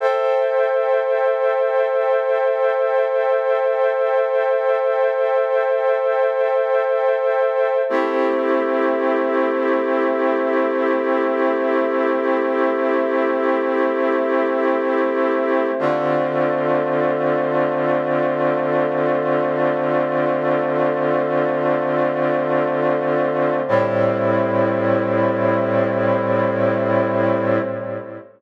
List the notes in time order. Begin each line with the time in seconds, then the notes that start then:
0.00 A4 C5 E5 G5
7.89 A3 C4 E4 G4
15.79 D3 A3 C4 F4
23.68 A2 G3 C4 E4